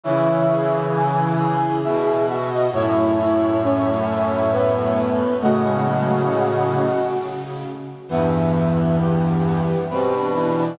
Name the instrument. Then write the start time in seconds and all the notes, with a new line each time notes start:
brass section
0.04 C#3 E3 E4 C#5 E5
0.50 G#4
0.94 E4 G#5
1.39 G#4
1.83 B2 E4 E5
2.28 F#4 E5
2.51 D#5
2.72 F#2 A2 E4 C#5 E5
3.19 E4
3.63 C#4
4.51 B3 B4
4.97 B4
5.41 A2 C#3 A3 F#4 D#5 F#5
5.64 G#3
5.85 F#3
6.29 C#3
6.76 C#3
8.09 E2 G2 E3 B3 E5
8.55 E5
8.98 B3 G4
9.45 B3
9.90 B2 G3 C4 B4
10.14 D4
10.34 E3 D4
10.57 D4